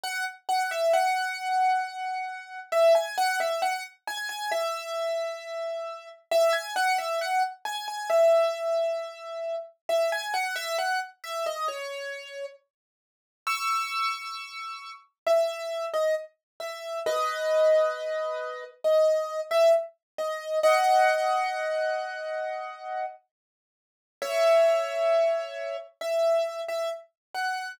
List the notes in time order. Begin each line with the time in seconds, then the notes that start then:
0.03 F#5
0.49 F#5
0.71 E5
0.93 F#5
2.72 E5
2.95 G#5
3.18 F#5
3.40 E5
3.62 F#5
4.07 G#5
4.29 G#5
4.51 E5
6.31 E5
6.53 G#5
6.76 F#5
6.98 E5
7.21 F#5
7.65 G#5
7.88 G#5
8.10 E5
9.89 E5
10.12 G#5
10.34 F#5
10.56 E5
10.78 F#5
11.24 E5
11.46 D#5
11.68 C#5
13.47 C#6 E6
15.26 E5
15.93 D#5
16.60 E5
17.06 B4 D#5
18.84 D#5
19.51 E5
20.18 D#5
20.63 D#5 F#5
24.22 C#5 E5
26.01 E5
26.68 E5
27.35 F#5